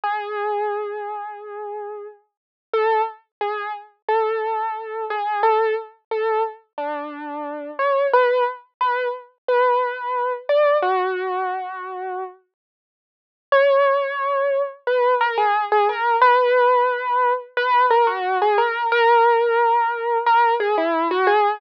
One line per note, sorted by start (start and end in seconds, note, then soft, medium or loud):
0.04 2.07 G#4 medium
2.73 3.02 A4 loud
3.41 3.72 G#4 medium
4.08 5.05 A4 medium
5.10 5.42 G#4 medium
5.43 5.74 A4 loud
6.11 6.43 A4 medium
6.78 7.71 D4 medium
7.79 8.07 C#5 medium
8.13 8.44 B4 loud
8.81 9.08 B4 medium
9.48 10.33 B4 medium
10.49 10.77 D5 medium
10.82 12.24 F#4 loud
13.52 14.62 C#5 loud
14.87 15.14 B4 medium
15.21 15.37 A#4 loud
15.37 15.65 G#4 loud
15.72 15.88 G#4 loud
15.89 16.16 A#4 loud
16.21 17.33 B4 loud
17.57 17.86 B4 loud
17.90 18.06 A#4 loud
18.07 18.38 F#4 loud
18.42 18.58 G#4 loud
18.58 18.87 A#4 loud
18.92 20.18 A#4 loud
20.26 20.54 A#4 loud
20.60 20.76 G#4 loud
20.78 21.08 E4 loud
21.11 21.27 F#4 loud
21.27 21.59 G#4 loud